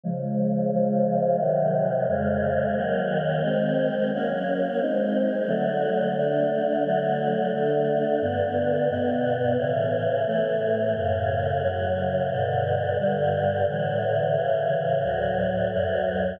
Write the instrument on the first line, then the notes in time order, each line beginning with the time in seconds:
choir aahs
0.04 C#3 F3 G#3
0.72 C#3 F3 G#3
1.39 C3 D#3 F#3
2.08 F2 C#3 G#3
2.76 D#3 F#3 A#3
3.43 D#3 G#3 C4
4.13 F#3 A#3 C#4
4.81 G#3 C4 D#4
5.48 D3 F#3 A3
6.16 D3 A3 D4
6.85 D3 F#3 A3
7.53 D3 A3 D4
8.21 G2 D3 B3
8.90 G2 B2 B3
9.57 A2 C#3 E3
10.27 A2 E3 A3
10.95 F#2 A2 C#3
11.63 F#2 C#3 F#3
12.30 G2 B2 D3
12.98 G2 D3 G3
13.69 A2 D3 E3
14.36 A2 C#3 E3
15.03 D2 A2 F#3
15.73 D2 F#2 F#3